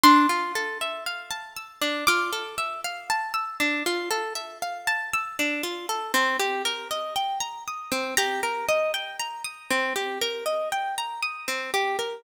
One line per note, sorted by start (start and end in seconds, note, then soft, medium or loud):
0.04 0.27 D4 medium
0.04 1.97 C6 medium
0.29 0.52 F4 medium
0.56 0.78 A4 medium
0.81 1.04 E5 soft
1.06 1.29 F5 medium
1.31 1.54 A5 medium
1.57 1.79 E6 medium
1.82 2.04 D4 medium
2.07 2.31 F4 medium
2.07 3.02 D6 medium
2.33 2.56 A4 medium
2.58 2.81 E5 medium
2.85 3.07 F5 medium
3.10 3.33 A5 medium
3.34 3.57 E6 medium
3.60 3.83 D4 medium
3.86 4.09 F4 medium
4.11 4.33 A4 medium
4.35 4.58 E5 medium
4.62 4.85 F5 medium
4.87 5.10 A5 medium
5.14 5.36 E6 medium
5.39 5.62 D4 medium
5.63 5.86 F4 medium
5.89 6.12 A4 medium
6.14 6.37 C4 medium
6.40 6.62 G4 medium
6.65 6.88 A#4 medium
6.91 7.14 D#5 medium
7.16 7.39 G5 medium
7.40 7.63 A#5 medium
7.68 7.90 D#6 medium
7.92 8.15 C4 medium
8.17 8.41 G4 medium
8.17 9.19 A#5 medium
8.43 8.66 A#4 medium
8.69 8.92 D#5 medium
8.94 9.17 G5 medium
9.19 9.42 A#5 medium
9.44 9.67 D#6 medium
9.71 9.93 C4 medium
9.96 10.19 G4 medium
10.21 10.44 A#4 medium
10.46 10.69 D#5 medium
10.72 10.95 G5 medium
10.98 11.21 A#5 medium
11.23 11.46 D#6 medium
11.48 11.71 C4 medium
11.74 11.97 G4 medium
11.99 12.22 A#4 soft